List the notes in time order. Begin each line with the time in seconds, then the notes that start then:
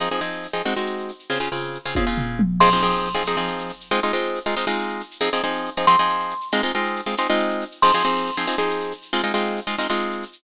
0.00 F3 C4 D#4 G#4, shaker
0.11 F3 C4 D#4 G#4, shaker
0.21 F3 C4 D#4 G#4, shaker
0.32 shaker
0.43 shaker
0.53 F3 C4 D#4 G#4, shaker
0.65 G#3 C4 D#4 F#4, tambourine, shaker
0.76 G#3 C4 D#4 F#4, shaker
0.86 shaker
0.98 shaker
1.09 shaker
1.19 shaker
1.30 C#3 C4 F4 G#4, shaker
1.40 C#3 C4 F4 G#4, shaker
1.52 C#3 C4 F4 G#4, shaker
1.63 shaker
1.74 shaker
1.85 C#3 C4 F4 G#4, shaker
1.95 C#3 C4 F4 G#4, kick, high tom
2.07 C#3 C4 F4 G#4
2.18 floor tom
2.39 mid tom
2.60 F3 C4 D#4 G#4 C6, crash
2.72 F3 C4 D#4 G#4, shaker
2.82 F3 C4 D#4 G#4, shaker
2.94 shaker
3.04 shaker
3.14 F3 C4 D#4 G#4, shaker
3.25 F3 C4 D#4 G#4, tambourine, shaker
3.37 F3 C4 D#4 G#4, shaker
3.48 shaker
3.59 shaker
3.69 shaker
3.80 shaker
3.91 G#3 C4 D#4 F4, shaker
4.03 G#3 C4 D#4 F4, shaker
4.13 G#3 C4 D#4 F4, shaker
4.24 shaker
4.35 shaker
4.46 G#3 C4 D#4 F4, shaker
4.56 G#3 C4 D#4 F4, tambourine, shaker
4.67 G#3 C4 D#4 F4, shaker
4.78 shaker
4.89 shaker
5.00 shaker
5.11 shaker
5.21 F3 C4 D#4 G#4, shaker
5.33 F3 C4 D#4 G#4, shaker
5.43 F3 C4 D#4 G#4, shaker
5.54 shaker
5.65 shaker
5.76 F3 C4 D#4 G#4, shaker
5.87 F3 C4 D#4 G#4 C6, tambourine, shaker
5.98 F3 C4 D#4 G#4, shaker
6.09 shaker
6.20 shaker
6.30 shaker
6.41 shaker
6.52 G#3 C4 D#4 F4, shaker
6.63 G#3 C4 D#4 F4, shaker
6.74 G#3 C4 D#4 F4, shaker
6.84 shaker
6.96 shaker
7.06 G#3 C4 D#4 F4, shaker
7.17 G#3 C4 D#4 F4, tambourine, shaker
7.28 G#3 C4 D#4 F4, shaker
7.39 shaker
7.50 shaker
7.61 shaker
7.71 shaker
7.82 F3 C4 D#4 G#4 C6, crash
7.94 F3 C4 D#4 G#4, shaker
8.04 F3 C4 D#4 G#4, shaker
8.15 shaker
8.26 shaker
8.37 F3 C4 D#4 G#4, shaker
8.47 F3 C4 D#4 G#4, tambourine, shaker
8.58 F3 C4 D#4 G#4, shaker
8.70 shaker
8.80 shaker
8.91 shaker
9.02 shaker
9.13 G#3 C4 D#4 F4, shaker
9.24 G#3 C4 D#4 F4, shaker
9.34 G#3 C4 D#4 F4, shaker
9.46 shaker
9.57 shaker
9.67 G#3 C4 D#4 F4, shaker
9.78 G#3 C4 D#4 F4, tambourine, shaker
9.89 G#3 C4 D#4 F4, shaker
10.00 shaker
10.11 shaker
10.22 shaker
10.33 shaker